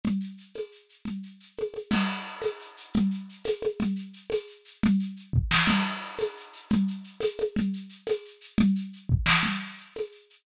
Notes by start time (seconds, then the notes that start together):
0.04 low conga, shaker
0.20 shaker
0.38 shaker
0.54 tambourine, high conga, shaker
0.72 shaker
0.89 shaker
1.05 low conga, shaker
1.23 shaker
1.40 shaker
1.57 tambourine, high conga, shaker
1.74 high conga, shaker
1.91 crash, low conga, shaker
2.08 shaker
2.27 shaker
2.42 tambourine, high conga, shaker
2.59 shaker
2.77 shaker
2.94 low conga, shaker
3.11 shaker
3.29 shaker
3.44 tambourine, high conga, shaker
3.62 high conga, shaker
3.80 low conga, shaker
3.96 shaker
4.13 shaker
4.30 tambourine, high conga, shaker
4.47 shaker
4.65 shaker
4.83 low conga, shaker
4.99 shaker
5.16 shaker
5.33 kick
5.51 snare
5.66 crash, low conga, shaker
5.86 shaker
6.01 shaker
6.18 tambourine, high conga, shaker
6.37 shaker
6.53 shaker
6.70 low conga, shaker
6.88 shaker
7.04 shaker
7.20 tambourine, high conga, shaker
7.38 high conga, shaker
7.56 low conga, shaker
7.73 shaker
7.89 shaker
8.07 tambourine, high conga, shaker
8.25 shaker
8.41 shaker
8.58 low conga, shaker
8.75 shaker
8.93 shaker
9.09 kick
9.26 snare
9.43 low conga, shaker
9.60 shaker
9.78 shaker
9.95 tambourine, high conga, shaker
10.12 shaker
10.30 shaker